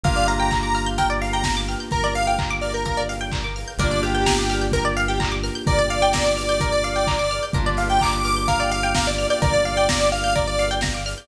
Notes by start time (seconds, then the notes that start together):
0.04 G1 A#3 D4 F4 G4 A#4 F5, kick, closed hi-hat
0.16 D5
0.28 F5 A#5, open hi-hat
0.40 G5
0.51 A#5, kick, clap
0.63 D6
0.75 F6, open hi-hat
0.86 G6
0.98 A#4 G5, kick, closed hi-hat
1.10 D5
1.22 F5, open hi-hat
1.33 G5 A#5
1.44 A#5, kick, snare
1.57 D6
1.68 F6, open hi-hat
1.80 G6
1.91 G1 A#4, kick, closed hi-hat
2.04 D5
2.15 F5, open hi-hat
2.27 F5 G5
2.39 A#5, kick, clap
2.50 D6
2.61 D5 F6, open hi-hat
2.74 A#4 G6
2.85 A#4, kick, closed hi-hat
2.97 D5
3.09 F5, open hi-hat
3.21 G5
3.32 A#5, kick, clap
3.44 D6
3.56 F6, open hi-hat
3.68 G6
3.78 G1 A#3 D4 F4 G4 A#4 D5, kick, closed hi-hat
3.91 D5
4.03 G4 F5, open hi-hat
4.15 G5
4.26 A#5, kick, snare
4.38 D6
4.49 F6, open hi-hat
4.61 G6
4.72 A#4, kick, closed hi-hat
4.85 D5
4.97 F5, open hi-hat
5.08 G4 G5
5.20 A#5, kick, clap
5.32 D6
5.43 F6, open hi-hat
5.55 G6
5.67 G1 A#4 D5, kick, closed hi-hat
5.79 D5
5.90 F5, open hi-hat
6.02 G5
6.13 A#5, kick, snare
6.26 D6
6.37 F6, open hi-hat
6.49 G6
6.60 A#4, kick, closed hi-hat
6.72 D5
6.83 F5, open hi-hat
6.96 G5
7.07 A#5, kick, clap
7.19 D6
7.31 F6, open hi-hat
7.43 G6
7.53 G1 A#3 D4 F4 G4 A#4, kick, closed hi-hat
7.66 D5
7.77 F5, open hi-hat
7.90 G5
8.01 A#5 D6, kick, clap
8.13 D6
8.24 D6 F6, open hi-hat
8.36 G6
8.48 A#4 F5, kick, closed hi-hat
8.60 D5
8.71 F5, open hi-hat
8.83 G5
8.95 F5 A#5, kick, snare
9.07 D5 D6
9.18 F6, open hi-hat
9.30 D5 G6
9.42 G1 A#4 D5, kick, closed hi-hat
9.54 D5
9.65 F5, open hi-hat
9.77 G5
9.89 A#5, kick, snare
10.01 D6
10.12 F5 F6, open hi-hat
10.24 G6
10.35 A#4 D5, kick, closed hi-hat
10.47 D5
10.58 F5, open hi-hat
10.71 G5
10.81 A#5, kick, snare
10.94 D6
11.06 F6, open hi-hat
11.18 G6